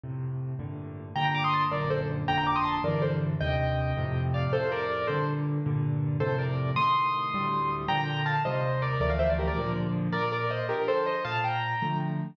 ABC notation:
X:1
M:6/8
L:1/16
Q:3/8=107
K:Gm
V:1 name="Acoustic Grand Piano"
z12 | [gb] [gb] [bd'] [c'e'] [ac'] z [Bd]2 [Ac] z3 | [gb] [gb] [bd'] [c'e'] [ac'] z [Bd]2 [Ac] z3 | [eg]10 [df]2 |
[Ac]2 [Bd]4 [Ac]2 z4 | z6 [Ac]2 [Bd]4 | [c'e']12 | [gb]4 [fa]2 [ce]4 [Bd]2 |
[Bd] [df] [c=e] [Bd] [GB] [Bd]3 z4 | [K:Bb] [Bd]2 [Bd]2 [ce]2 [GB]2 [Ac]2 [ce]2 | [fa]2 [gb]6 z4 |]
V:2 name="Acoustic Grand Piano"
[F,,A,,C,]6 [G,,A,,B,,D,]6 | [G,,B,,D,]6 [G,,,^F,,B,,D,]6 | [G,,,F,,B,,D,]6 [B,,,G,,D,=E,]6 | [E,,G,,C,]6 [F,,A,,C,]6 |
[F,,A,,C,]6 [G,,B,,D,]6 | [G,,B,,D,]6 [F,,A,,C,]6 | [A,,C,E,]6 [D,,A,,G,]6 | [B,,D,F,]6 [E,,C,G,]6 |
[D,,=E,F,A,]6 [B,,D,F,]6 | [K:Bb] B,,6 [D,F,]6 | B,,6 [D,F,A,]6 |]